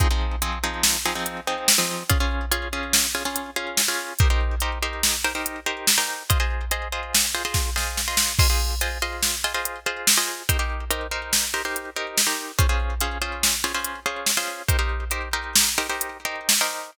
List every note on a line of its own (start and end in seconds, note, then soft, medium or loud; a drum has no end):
0.00 0.08 F3 medium
0.00 0.08 C4 medium
0.00 0.08 D#4 medium
0.00 0.08 G#4 loud
0.00 kick loud
0.00 closed hi-hat loud
0.11 0.36 F3 medium
0.11 0.36 C4 medium
0.11 0.36 D#4 medium
0.11 0.36 G#4 medium
0.42 0.59 F3 medium
0.42 0.59 C4 medium
0.42 0.59 D#4 medium
0.42 0.59 G#4 medium
0.42 closed hi-hat medium
0.64 0.97 F3 medium
0.64 0.97 C4 medium
0.64 0.97 D#4 medium
0.64 0.97 G#4 medium
0.83 snare loud
1.06 1.14 F3 medium
1.06 1.14 C4 medium
1.06 1.14 D#4 medium
1.06 1.14 G#4 medium
1.15 1.41 F3 medium
1.15 1.41 C4 medium
1.15 1.41 D#4 medium
1.15 1.41 G#4 medium
1.26 closed hi-hat medium
1.47 1.73 F3 medium
1.47 1.73 C4 medium
1.47 1.73 D#4 medium
1.47 1.73 G#4 medium
1.68 snare loud
1.78 2.03 F3 medium
1.78 2.03 C4 medium
1.78 2.03 D#4 medium
1.78 2.03 G#4 medium
2.10 2.18 C#4 medium
2.10 2.18 F4 loud
2.10 2.18 G#4 medium
2.10 kick loud
2.10 closed hi-hat loud
2.20 2.45 C#4 medium
2.20 2.45 F4 medium
2.20 2.45 G#4 medium
2.51 2.68 C#4 medium
2.51 2.68 F4 medium
2.51 2.68 G#4 medium
2.51 closed hi-hat loud
2.73 3.06 C#4 medium
2.73 3.06 F4 medium
2.73 3.06 G#4 medium
2.93 snare loud
3.15 3.23 C#4 medium
3.15 3.23 F4 medium
3.15 3.23 G#4 medium
3.25 3.50 C#4 medium
3.25 3.50 F4 medium
3.25 3.50 G#4 medium
3.36 closed hi-hat medium
3.56 3.81 C#4 medium
3.56 3.81 F4 medium
3.56 3.81 G#4 medium
3.77 snare loud
3.88 4.13 C#4 medium
3.88 4.13 F4 medium
3.88 4.13 G#4 medium
4.19 4.28 D#4 medium
4.19 4.28 G4 medium
4.19 4.28 A#4 medium
4.19 4.28 C5 medium
4.19 kick loud
4.19 closed hi-hat medium
4.30 4.55 D#4 medium
4.30 4.55 G4 medium
4.30 4.55 A#4 medium
4.30 4.55 C5 medium
4.60 4.78 D#4 medium
4.60 4.78 G4 medium
4.60 4.78 A#4 medium
4.60 4.78 C5 medium
4.60 closed hi-hat medium
4.83 5.16 D#4 medium
4.83 5.16 G4 medium
4.83 5.16 A#4 medium
4.83 5.16 C5 medium
5.03 snare loud
5.24 5.33 D#4 medium
5.24 5.33 G4 medium
5.24 5.33 A#4 medium
5.24 5.33 C5 medium
5.35 5.60 D#4 medium
5.35 5.60 G4 medium
5.35 5.60 A#4 medium
5.35 5.60 C5 medium
5.46 closed hi-hat medium
5.66 5.91 D#4 medium
5.66 5.91 G4 medium
5.66 5.91 A#4 medium
5.66 5.91 C5 medium
5.87 snare loud
5.98 6.23 D#4 medium
5.98 6.23 G4 medium
5.98 6.23 A#4 medium
5.98 6.23 C5 medium
6.30 6.38 F4 medium
6.30 6.38 G#4 medium
6.30 6.38 C5 medium
6.30 6.38 D#5 loud
6.30 kick loud
6.30 closed hi-hat loud
6.40 6.65 F4 medium
6.40 6.65 G#4 medium
6.40 6.65 C5 medium
6.40 6.65 D#5 medium
6.71 6.88 F4 medium
6.71 6.88 G#4 medium
6.71 6.88 C5 medium
6.71 6.88 D#5 medium
6.71 closed hi-hat medium
6.92 7.26 F4 medium
6.92 7.26 G#4 medium
6.92 7.26 C5 medium
6.92 7.26 D#5 medium
7.15 snare loud
7.35 7.43 F4 medium
7.35 7.43 G#4 medium
7.35 7.43 C5 medium
7.35 7.43 D#5 medium
7.45 7.70 F4 medium
7.45 7.70 G#4 medium
7.45 7.70 C5 medium
7.45 7.70 D#5 medium
7.54 kick medium
7.54 snare medium
7.76 8.01 F4 medium
7.76 8.01 G#4 medium
7.76 8.01 C5 medium
7.76 8.01 D#5 medium
7.76 snare medium
7.97 snare medium
8.08 8.33 F4 medium
8.08 8.33 G#4 medium
8.08 8.33 C5 medium
8.08 8.33 D#5 medium
8.17 snare loud
8.39 8.48 F4 medium
8.39 8.48 G#4 medium
8.39 8.48 C5 medium
8.39 8.48 D#5 medium
8.39 kick loud
8.39 crash loud
8.50 8.75 F4 medium
8.50 8.75 G#4 medium
8.50 8.75 C5 medium
8.50 8.75 D#5 medium
8.81 8.98 F4 medium
8.81 8.98 G#4 medium
8.81 8.98 C5 medium
8.81 8.98 D#5 medium
8.81 closed hi-hat medium
9.02 9.36 F4 medium
9.02 9.36 G#4 medium
9.02 9.36 C5 medium
9.02 9.36 D#5 medium
9.23 snare medium
9.44 9.53 F4 medium
9.44 9.53 G#4 medium
9.44 9.53 C5 medium
9.44 9.53 D#5 medium
9.54 9.80 F4 medium
9.54 9.80 G#4 medium
9.54 9.80 C5 medium
9.54 9.80 D#5 medium
9.65 closed hi-hat medium
9.86 10.11 F4 medium
9.86 10.11 G#4 medium
9.86 10.11 C5 medium
9.86 10.11 D#5 medium
10.07 snare loud
10.17 10.43 F4 medium
10.17 10.43 G#4 medium
10.17 10.43 C5 medium
10.17 10.43 D#5 medium
10.49 10.57 D#4 medium
10.49 10.57 G4 medium
10.49 10.57 A#4 medium
10.49 10.57 C5 loud
10.49 kick medium
10.49 closed hi-hat loud
10.59 10.84 D#4 medium
10.59 10.84 G4 medium
10.59 10.84 A#4 medium
10.59 10.84 C5 medium
10.90 11.07 D#4 medium
10.90 11.07 G4 medium
10.90 11.07 A#4 medium
10.90 11.07 C5 medium
10.90 closed hi-hat loud
11.11 11.45 D#4 medium
11.11 11.45 G4 medium
11.11 11.45 A#4 medium
11.11 11.45 C5 medium
11.33 snare loud
11.54 11.62 D#4 medium
11.54 11.62 G4 medium
11.54 11.62 A#4 medium
11.54 11.62 C5 medium
11.65 11.90 D#4 medium
11.65 11.90 G4 medium
11.65 11.90 A#4 medium
11.65 11.90 C5 medium
11.76 closed hi-hat medium
11.96 12.22 D#4 medium
11.96 12.22 G4 medium
11.96 12.22 A#4 medium
11.96 12.22 C5 medium
12.18 snare loud
12.27 12.52 D#4 medium
12.27 12.52 G4 medium
12.27 12.52 A#4 medium
12.27 12.52 C5 medium
12.59 12.67 C#4 medium
12.59 12.67 F4 medium
12.59 12.67 G#4 medium
12.59 12.67 C5 loud
12.59 kick loud
12.59 closed hi-hat medium
12.69 12.94 C#4 medium
12.69 12.94 F4 medium
12.69 12.94 G#4 medium
12.69 12.94 C5 medium
13.01 13.18 C#4 medium
13.01 13.18 F4 medium
13.01 13.18 G#4 medium
13.01 13.18 C5 medium
13.01 closed hi-hat medium
13.22 13.55 C#4 medium
13.22 13.55 F4 medium
13.22 13.55 G#4 medium
13.22 13.55 C5 medium
13.43 snare loud
13.64 13.72 C#4 medium
13.64 13.72 F4 medium
13.64 13.72 G#4 medium
13.64 13.72 C5 medium
13.74 14.00 C#4 medium
13.74 14.00 F4 medium
13.74 14.00 G#4 medium
13.74 14.00 C5 medium
13.84 closed hi-hat medium
14.06 14.31 C#4 medium
14.06 14.31 F4 medium
14.06 14.31 G#4 medium
14.06 14.31 C5 medium
14.26 snare medium
14.37 14.62 C#4 medium
14.37 14.62 F4 medium
14.37 14.62 G#4 medium
14.37 14.62 C5 medium
14.68 14.77 D#4 medium
14.68 14.77 G4 medium
14.68 14.77 A#4 medium
14.68 14.77 C5 medium
14.68 kick medium
14.68 closed hi-hat loud
14.79 15.04 D#4 medium
14.79 15.04 G4 medium
14.79 15.04 A#4 medium
14.79 15.04 C5 medium
15.11 15.29 D#4 medium
15.11 15.29 G4 medium
15.11 15.29 A#4 medium
15.11 15.29 C5 medium
15.11 closed hi-hat medium
15.33 15.69 D#4 medium
15.33 15.69 G4 medium
15.33 15.69 A#4 medium
15.33 15.69 C5 medium
15.55 snare loud
15.78 15.87 D#4 medium
15.78 15.87 G4 medium
15.78 15.87 A#4 medium
15.78 15.87 C5 medium
15.89 16.18 D#4 medium
15.89 16.18 G4 medium
15.89 16.18 A#4 medium
15.89 16.18 C5 medium
16.01 closed hi-hat loud
16.25 16.54 D#4 medium
16.25 16.54 G4 medium
16.25 16.54 A#4 medium
16.25 16.54 C5 medium
16.49 snare loud
16.61 16.91 D#4 medium
16.61 16.91 G4 medium
16.61 16.91 A#4 medium
16.61 16.91 C5 medium